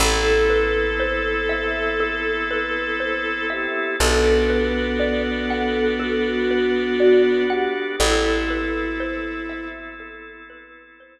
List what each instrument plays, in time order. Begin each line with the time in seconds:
0.00 electric bass (finger) A1, drawbar organ B3 C4 E4 A4, flute A4, violin A4, xylophone A4
0.50 xylophone B4
1.00 xylophone C5
1.49 xylophone E5
2.00 xylophone A4
2.51 xylophone B4
3.00 xylophone C5
3.50 flute G4, xylophone E5
3.99 electric bass (finger) B1, violin B3, drawbar organ B3 D4 F#4 A4, flute A4, xylophone A4
4.50 xylophone B4
4.99 xylophone D5
5.50 xylophone F#5
6.00 flute F#4, xylophone A4
6.51 xylophone B4
7.00 flute F#4, xylophone D5
7.50 flute G4, xylophone F#5
8.00 electric bass (finger) A1, drawbar organ B3 C4 E4 A4, violin E4, flute A4, xylophone A4
8.50 xylophone B4
9.00 xylophone C5
9.49 xylophone E5
10.00 xylophone A4
10.50 xylophone B4
11.00 xylophone C5